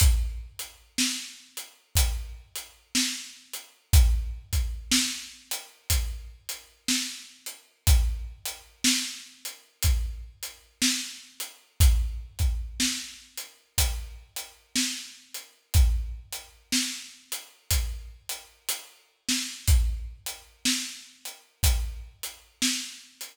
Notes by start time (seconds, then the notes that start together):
0.00 kick, closed hi-hat
0.59 closed hi-hat
0.98 snare
1.57 closed hi-hat
1.95 kick, closed hi-hat
2.56 closed hi-hat
2.95 snare
3.53 closed hi-hat
3.93 kick, closed hi-hat
4.53 kick, closed hi-hat
4.91 snare
5.51 closed hi-hat
5.90 kick, closed hi-hat
6.49 closed hi-hat
6.88 snare
7.46 closed hi-hat
7.87 kick, closed hi-hat
8.45 closed hi-hat
8.84 snare
9.45 closed hi-hat
9.83 kick, closed hi-hat
10.43 closed hi-hat
10.82 snare
11.40 closed hi-hat
11.80 kick, closed hi-hat
12.39 kick, closed hi-hat
12.80 snare
13.38 closed hi-hat
13.78 kick, closed hi-hat
14.36 closed hi-hat
14.76 snare
15.34 closed hi-hat
15.74 kick, closed hi-hat
16.33 closed hi-hat
16.72 snare
17.32 closed hi-hat
17.70 kick, closed hi-hat
18.29 closed hi-hat
18.69 closed hi-hat
19.28 snare
19.68 kick, closed hi-hat
20.26 closed hi-hat
20.65 snare
21.25 closed hi-hat
21.63 kick, closed hi-hat
22.23 closed hi-hat
22.62 snare
23.21 closed hi-hat